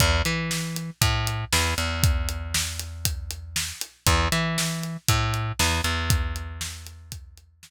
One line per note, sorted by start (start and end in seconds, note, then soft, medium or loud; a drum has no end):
0.00 0.22 E2 loud
0.00 kick loud
0.00 closed hi-hat loud
0.25 0.90 E3 medium
0.25 closed hi-hat medium
0.51 snare loud
0.76 closed hi-hat medium
1.01 1.45 A2 loud
1.01 kick loud
1.01 closed hi-hat loud
1.27 closed hi-hat medium
1.53 1.74 E2 medium
1.53 snare loud
1.78 3.72 E2 medium
1.78 closed hi-hat medium
2.03 kick loud
2.03 closed hi-hat loud
2.29 closed hi-hat medium
2.54 snare loud
2.79 closed hi-hat medium
3.05 kick medium
3.05 closed hi-hat loud
3.31 closed hi-hat medium
3.56 snare loud
3.81 closed hi-hat medium
4.07 4.28 E2 loud
4.07 kick loud
4.07 closed hi-hat loud
4.32 4.97 E3 medium
4.32 closed hi-hat medium
4.58 snare loud
4.83 closed hi-hat medium
5.08 5.52 A2 loud
5.08 kick loud
5.08 closed hi-hat loud
5.34 closed hi-hat medium
5.59 5.81 E2 loud
5.59 snare loud
5.84 7.70 E2 medium
5.84 closed hi-hat medium
6.10 kick loud
6.10 closed hi-hat loud
6.36 closed hi-hat medium
6.61 snare loud
6.87 closed hi-hat medium
7.12 kick loud
7.12 closed hi-hat loud
7.38 closed hi-hat medium
7.63 snare loud